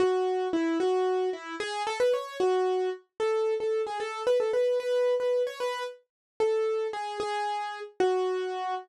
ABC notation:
X:1
M:6/8
L:1/8
Q:3/8=150
K:F#m
V:1 name="Acoustic Grand Piano"
F4 E2 | F4 E2 | G2 A B c2 | F4 z2 |
[K:A] A3 A2 G | A2 B A B2 | B3 B2 c | B2 z4 |
[K:F#m] A4 G2 | G5 z | F6 |]